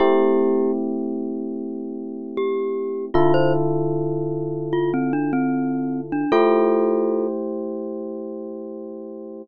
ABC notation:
X:1
M:4/4
L:1/16
Q:1/4=76
K:Am
V:1 name="Glockenspiel"
[EG]4 z8 G4 | F c z6 F C D C4 D | [FA]6 z10 |]
V:2 name="Electric Piano 1"
[A,CEG]16 | [D,EFA]16 | [A,EGc]16 |]